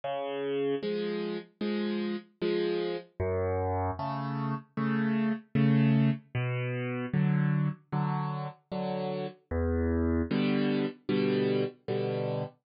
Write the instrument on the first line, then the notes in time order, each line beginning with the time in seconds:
acoustic grand piano
0.04 C#3
0.83 F3 G#3
1.61 F3 G#3
2.41 F3 G#3
3.20 F#2
3.99 C#3 A3
4.77 C#3 A3
5.55 C#3 A3
6.35 B2
7.13 D3 F#3
7.92 D3 F#3
8.72 D3 F#3
9.51 E2
10.31 B2 D3 G3
11.09 B2 D3 G3
11.88 B2 D3 G3